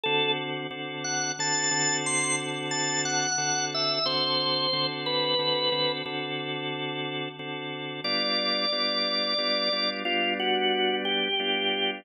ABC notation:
X:1
M:12/8
L:1/8
Q:3/8=60
K:D
V:1 name="Drawbar Organ"
A z2 f a2 =c' z a f2 e | =c3 B3 z6 | d6 =F ^F2 G3 |]
V:2 name="Drawbar Organ"
[D,=CF]2 [D,CFA]2 [D,CFA] [D,CFA]5 [D,CFA]2 | [D,=CFA]2 [D,CFA]2 [D,CFA] [D,CFA] [D,CFA]4 [D,CFA]2 | [G,B,D=F]2 [G,B,DF]2 [G,B,DF] [G,B,DF] [G,B,D]4 [G,B,DF]2 |]